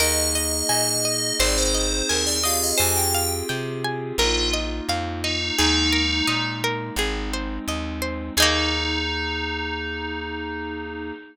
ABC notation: X:1
M:4/4
L:1/16
Q:1/4=86
K:Eb
V:1 name="Tubular Bells"
e2 e2 e4 d c3 B d f e | a g2 z5 F2 z4 E2 | E6 z10 | E16 |]
V:2 name="Electric Piano 2"
[B,EA]8 [CEA]6 [CFGA]2- | [CFGA]8 [B,EF]8 | [A,B,E]8 [A,CE]8 | [B,EA]16 |]
V:3 name="Pizzicato Strings"
B2 e2 a2 e2 c2 e2 a2 e2 | c2 f2 g2 a2 B2 e2 f2 e2 | A2 B2 e2 B2 A2 c2 e2 c2 | [B,EA]16 |]
V:4 name="Electric Bass (finger)" clef=bass
E,,4 B,,4 A,,,4 E,,4 | F,,4 C,4 B,,,4 F,,4 | E,,4 B,,4 A,,,4 E,,4 | E,,16 |]